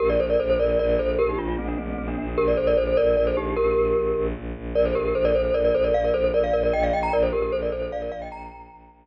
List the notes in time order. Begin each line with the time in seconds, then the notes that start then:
0.00 A#1 G4 A#4
0.10 A#4 D5
0.19 A#1 A4 C5
0.30 A#4 D5
0.40 A#1 A4 C5
0.50 A4 C5
0.59 A#1 A#4 D5
0.79 A#1 A#4 D5
0.89 A#4 D5
0.99 A#1 A4 C5
1.19 A#1 G4 A#4
1.29 D#4 G4
1.38 A#1 D4 F4
1.48 D4 F4
1.58 A#1 A3 C4
1.68 A#3 D4
1.77 A#1 A3 C4
1.88 A3 C4
1.98 A#1 A3 C4
2.08 A#3 D4
2.18 A#1 A#3 D4
2.28 A#3 D4
2.37 A#1 G4 A#4
2.48 A#4 D5
2.57 A#1 A4 C5
2.67 A#4 D5
2.77 A#1 A4 C5
2.87 A4 C5
2.97 A#1 A#4 D5
3.16 A#1 A#4 D5
3.27 A4 C5
3.37 A#1 D#4 G4
3.57 A#1 G4 A#4
3.76 A#1
3.96 A#1
4.16 A#1
4.35 A#1
4.56 A#1
4.75 A#1 A#4 D5
4.85 A4 C5
4.95 A#1 G4 A#4
5.05 G4 A#4
5.15 A#1 A4 C5
5.25 A#4 D5
5.34 A#1 A4 C5
5.45 A4 C5
5.54 A#1 A#4 D5
5.65 A#4 D5
5.74 A#1 A4 C5
5.84 A#4 D5
5.94 A#1 D5 F5
6.04 A#4 D5
6.14 A#1 A4 C5
6.24 A4 C5
6.34 A#1 A#4 D5
6.44 D5 F5
6.53 A#1 A#4 D5
6.63 A#4 D5
6.73 A#1 D#5 G5
6.83 D5 F5
6.93 A#1 D#5 G5
7.03 G5 A#5
7.13 A#1 A#4 D5
7.23 A4 C5
7.33 A#1 G4 A#4
7.42 G4 A#4
7.52 A#1 A4 C5
7.62 A#4 D5
7.71 A#1 A4 C5
7.82 A4 C5
7.92 A#1 D5 F5
8.02 A#4 D5
8.12 A#1 D5 F5
8.22 D#5 G5
8.32 A#1 G5 A#5
8.51 A#1
8.71 A#1
8.90 A#1